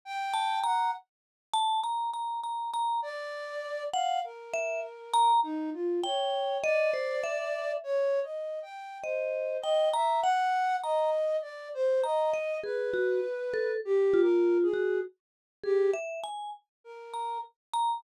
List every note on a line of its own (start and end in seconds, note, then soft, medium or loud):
0.05 0.59 G5 loud
0.34 0.60 A5 medium
0.64 0.91 F#5 medium
0.64 0.91 A#5 medium
1.54 1.80 A5 loud
1.83 2.10 A#5 medium
2.14 2.41 A#5 medium
2.44 2.71 A#5 medium
2.73 3.00 A#5 medium
3.02 3.83 D5 loud
3.93 4.20 F5 medium
3.93 4.21 F#5 medium
4.24 5.32 A#4 medium
4.54 4.80 E5 loud
5.13 5.41 A#5 loud
5.43 5.70 D#4 medium
5.74 6.00 F4 medium
6.04 6.58 C#5 medium
6.04 6.58 G5 medium
6.63 7.72 D5 loud
6.63 6.91 D#5 loud
6.94 7.21 C5 medium
7.24 7.78 E5 medium
7.83 8.20 C#5 loud
8.23 8.59 D#5 medium
8.62 8.98 G5 medium
9.03 9.57 C5 medium
9.03 9.58 D#5 medium
9.62 9.89 D#5 loud
9.62 9.90 G5 medium
9.94 10.21 E5 medium
9.94 10.21 A#5 medium
10.22 10.76 F#5 loud
10.22 10.78 F#5 medium
10.83 11.37 D#5 loud
10.83 11.11 A#5 medium
11.42 11.69 D5 medium
11.74 12.01 C5 loud
12.04 12.58 D#5 medium
12.04 12.30 A#5 medium
12.34 12.61 D#5 medium
12.63 12.91 G#4 medium
12.63 13.72 B4 medium
12.94 13.21 F#4 medium
13.54 13.80 A4 medium
13.85 14.21 G4 loud
14.13 14.68 F4 medium
14.22 14.58 A#4 medium
14.62 14.98 G#4 medium
14.73 15.01 F#4 medium
15.63 15.91 G4 loud
15.63 15.91 G#4 medium
15.94 16.21 E5 medium
16.23 16.50 G#5 medium
16.84 17.38 A#4 medium
17.14 17.41 A#5 medium
17.73 18.00 A#5 medium